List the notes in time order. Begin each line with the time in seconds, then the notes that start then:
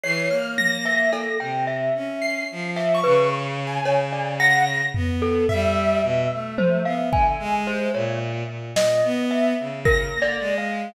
0.04 E3 C#5 C7
0.29 A#3 F6
0.58 A#6, high tom
0.85 E5
1.13 A4, cowbell
1.40 C3 G5
1.67 E5
1.95 C#4
2.22 C7
2.51 F3
2.76 E5, clap
2.95 C#6
3.04 C#3 B4
3.67 G#5
3.83 C#3 C#5, cowbell
4.12 D5
4.40 F#5 A#6
4.95 B3, floor tom
5.22 A4
5.49 G3 E5, floor tom
6.03 B2
6.32 A3
6.58 C5, high tom
6.85 B3 F5
7.12 D3 G#5, kick
7.39 G#3
7.67 C5
7.94 A#2 C#5
8.47 A#2
8.76 A#2 D#5, snare
9.04 B3
9.31 E5
9.60 C#3
9.85 A#4 A#6, kick
10.14 A#3
10.22 D5
10.40 G#3
10.58 F5